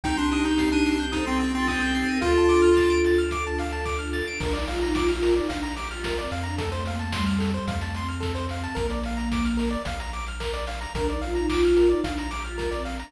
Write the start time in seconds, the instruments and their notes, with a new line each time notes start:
0.04 synth bass 1 C2, pad 5 (bowed) C4 D#4 G4, choir aahs D#4 G4, lead 1 (square) D#4 G5, kick, closed hi-hat
0.17 lead 1 (square) D4 C6
0.31 lead 1 (square) D4 D#6, open hi-hat
0.45 lead 1 (square) D#4 G6
0.58 lead 1 (square) C7, kick, snare
0.72 lead 1 (square) D4 D#7
0.86 lead 1 (square) C7, open hi-hat
1.00 lead 1 (square) G6
1.12 lead 1 (square) D#4 D#6, choir aahs A4 C5, kick, closed hi-hat
1.26 lead 1 (square) C4 C6
1.39 lead 1 (square) C4 G5, open hi-hat
1.54 lead 1 (square) C4 C6, choir aahs F4 A4
1.67 lead 1 (square) C4 D#6, choir aahs A4 C5, kick, clap
1.80 lead 1 (square) C4 G6
1.94 choir aahs A4 C5, lead 1 (square) C7, open hi-hat
2.09 choir aahs G4 A#4, lead 1 (square) D#7
2.21 synth bass 1 D2, pad 5 (bowed) D4 F4 A4, lead 1 (square) F4 F5, choir aahs F4 A4, kick, closed hi-hat
2.38 lead 1 (square) A5
2.49 lead 1 (square) D6, open hi-hat
2.62 lead 1 (square) F6
2.77 lead 1 (square) A6, kick, snare
2.90 lead 1 (square) D7
3.04 lead 1 (square) A6, open hi-hat
3.18 lead 1 (square) F6
3.31 lead 1 (square) D6, kick, closed hi-hat
3.47 lead 1 (square) A5
3.58 lead 1 (square) F5, open hi-hat
3.73 lead 1 (square) A5
3.85 lead 1 (square) D6, kick, clap
3.99 lead 1 (square) F6
4.13 lead 1 (square) A6, open hi-hat
4.28 lead 1 (square) D7
4.40 synth bass 1 A#1, choir aahs D4, lead 1 (square) A#4, kick, crash
4.53 choir aahs D#4, lead 1 (square) D5, closed hi-hat
4.67 choir aahs F4, lead 1 (square) F5, open hi-hat
4.81 choir aahs D#4, lead 1 (square) A#5, closed hi-hat
4.95 choir aahs F4, lead 1 (square) D6, kick, snare
5.08 choir aahs F4, lead 1 (square) F6, closed hi-hat
5.23 lead 1 (square) A#4, open hi-hat
5.35 choir aahs D#4, lead 1 (square) D5, closed hi-hat
5.49 synth bass 1 A#1, choir aahs D4, lead 1 (square) F5, kick, closed hi-hat
5.63 lead 1 (square) A#5, closed hi-hat
5.76 choir aahs G4, lead 1 (square) D6, open hi-hat
5.91 choir aahs F4, lead 1 (square) F6, closed hi-hat
6.04 lead 1 (square) A#4, kick, snare
6.17 choir aahs C4, lead 1 (square) D5, closed hi-hat
6.31 synth bass 1 F2, lead 1 (square) F5, open hi-hat
6.43 choir aahs D4, lead 1 (square) A#5, closed hi-hat
6.58 choir aahs A3, lead 1 (square) A4, kick, closed hi-hat
6.72 lead 1 (square) C5, closed hi-hat
6.85 choir aahs A#3, lead 1 (square) F5, open hi-hat
6.99 choir aahs A3, lead 1 (square) A5, closed hi-hat
7.13 choir aahs G3, lead 1 (square) C6, kick, snare
7.26 lead 1 (square) F6, closed hi-hat
7.39 lead 1 (square) A4, open hi-hat
7.54 choir aahs G3, lead 1 (square) C5, closed hi-hat
7.68 synth bass 1 F2, choir aahs A3, lead 1 (square) F5, kick, closed hi-hat
7.81 lead 1 (square) A5, closed hi-hat
7.94 choir aahs C4, lead 1 (square) C6, open hi-hat
8.08 lead 1 (square) F6, closed hi-hat
8.20 lead 1 (square) A4, kick, snare
8.35 lead 1 (square) C5, closed hi-hat
8.49 choir aahs C4, lead 1 (square) F5, open hi-hat
8.64 lead 1 (square) A5, closed hi-hat
8.75 synth bass 1 A#1, choir aahs A#3, lead 1 (square) A#4, kick, closed hi-hat
8.90 lead 1 (square) D5, closed hi-hat
9.03 lead 1 (square) F5, open hi-hat
9.17 lead 1 (square) A#5, closed hi-hat
9.32 lead 1 (square) D6, kick, snare
9.45 lead 1 (square) F6, closed hi-hat
9.57 lead 1 (square) A#4, open hi-hat
9.71 lead 1 (square) D5, closed hi-hat
9.85 synth bass 1 A#1, lead 1 (square) F5, kick, closed hi-hat
10.00 lead 1 (square) A#5, closed hi-hat
10.13 lead 1 (square) D6, open hi-hat
10.26 lead 1 (square) F6, closed hi-hat
10.40 lead 1 (square) A#4, kick, clap
10.54 lead 1 (square) D5, closed hi-hat
10.67 lead 1 (square) F5, open hi-hat
10.81 lead 1 (square) A#5, closed hi-hat
10.95 synth bass 1 A#1, choir aahs D4, lead 1 (square) A#4, kick, closed hi-hat
11.08 choir aahs D#4, lead 1 (square) D5, closed hi-hat
11.21 choir aahs F4, lead 1 (square) F5, open hi-hat
11.35 choir aahs D#4, lead 1 (square) A#5, closed hi-hat
11.49 choir aahs F4, lead 1 (square) D6, kick, clap
11.63 choir aahs F4, lead 1 (square) F6, closed hi-hat
11.77 lead 1 (square) A#4, open hi-hat
11.89 choir aahs D#4, lead 1 (square) D5, closed hi-hat
12.04 synth bass 1 A#1, choir aahs D4, lead 1 (square) F5, kick, closed hi-hat
12.18 lead 1 (square) A#5, closed hi-hat
12.31 choir aahs G4, lead 1 (square) D6, open hi-hat
12.44 choir aahs F4, lead 1 (square) F6, closed hi-hat
12.58 lead 1 (square) A#4, kick, snare
12.71 choir aahs C4, lead 1 (square) D5, closed hi-hat
12.85 lead 1 (square) F5, open hi-hat
12.99 choir aahs D4, lead 1 (square) A#5, open hi-hat